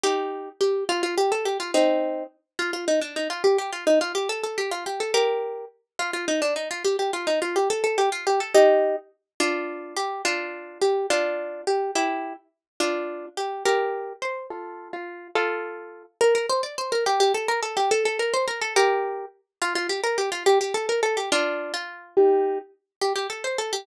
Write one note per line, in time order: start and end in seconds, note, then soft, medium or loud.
0.03 0.49 D#4 medium
0.03 0.49 G4 medium
0.61 0.84 G4 medium
0.89 1.02 F4 loud
1.03 1.15 F4 medium
1.18 1.31 G4 medium
1.32 1.45 A4 medium
1.45 1.58 G4 medium
1.60 1.71 F4 medium
1.74 2.24 C4 medium
1.74 2.24 D#4 medium
2.59 2.71 F4 medium
2.73 2.85 F4 medium
2.88 3.00 D#4 medium
3.01 3.15 D4 medium
3.16 3.28 D#4 medium
3.30 3.43 F4 medium
3.44 3.57 G4 medium
3.58 3.71 G4 medium
3.73 3.84 F4 medium
3.87 3.99 D#4 medium
4.01 4.12 F4 medium
4.15 4.28 G4 medium
4.29 4.42 A4 medium
4.43 4.57 A4 medium
4.58 4.70 G4 medium
4.71 4.84 F4 medium
4.86 5.00 G4 medium
5.00 5.12 A4 medium
5.14 5.65 G4 medium
5.14 5.65 A#4 medium
5.99 6.11 F4 medium
6.13 6.26 F4 medium
6.28 6.41 D#4 medium
6.42 6.54 D4 medium
6.56 6.69 D#4 medium
6.71 6.83 F4 medium
6.84 6.96 G4 medium
6.99 7.11 G4 medium
7.13 7.27 F4 medium
7.27 7.40 D#4 medium
7.42 7.55 F4 medium
7.56 7.68 G4 medium
7.70 7.83 A4 medium
7.84 7.97 A4 medium
7.98 8.09 G4 medium
8.12 8.25 F4 medium
8.27 8.40 G4 medium
8.40 8.53 A4 medium
8.54 8.96 D#4 medium
8.54 8.96 G4 medium
9.40 9.95 D4 medium
9.40 9.95 F4 medium
9.97 10.22 G4 medium
10.25 10.78 D4 medium
10.25 10.78 F4 medium
10.82 11.06 G4 medium
11.10 11.62 D4 medium
11.10 11.62 F4 medium
11.67 11.91 G4 medium
11.95 12.33 E4 medium
11.95 12.33 G4 medium
12.80 13.26 D4 medium
12.80 13.26 F4 medium
13.37 13.63 G4 medium
13.65 14.13 G4 medium
13.65 14.13 A#4 medium
14.22 14.47 C5 medium
14.50 14.89 F4 medium
14.50 14.89 A4 medium
14.93 15.28 F4 medium
15.35 16.03 F4 medium
15.35 16.03 A4 loud
16.21 16.34 A#4 loud
16.35 16.46 A#4 medium
16.49 16.61 C5 medium
16.63 16.75 D5 medium
16.78 16.91 C5 medium
16.92 17.04 A#4 medium
17.06 17.20 G4 medium
17.20 17.33 G4 medium
17.34 17.47 A4 medium
17.48 17.60 A#4 medium
17.63 17.76 A4 medium
17.77 17.90 G4 medium
17.91 18.04 A4 loud
18.05 18.18 A4 medium
18.19 18.33 A#4 medium
18.34 18.46 C5 medium
18.48 18.60 A#4 medium
18.61 18.74 A4 medium
18.76 19.25 G4 medium
18.76 19.25 A#4 loud
19.62 19.73 F4 loud
19.75 19.87 F4 medium
19.89 20.01 G4 medium
20.04 20.17 A#4 medium
20.18 20.30 G4 medium
20.32 20.43 F4 medium
20.46 20.59 G4 loud
20.61 20.73 G4 medium
20.74 20.86 A4 medium
20.89 21.01 A#4 medium
21.03 21.16 A4 medium
21.17 21.29 G4 medium
21.32 21.72 D4 medium
21.32 21.72 F4 loud
21.74 22.15 F4 medium
22.17 22.58 D#4 medium
22.17 22.58 G4 loud
23.01 23.13 G4 medium
23.16 23.27 G4 medium
23.30 23.43 A4 medium
23.44 23.57 C5 medium
23.58 23.72 A4 medium
23.73 23.85 G4 medium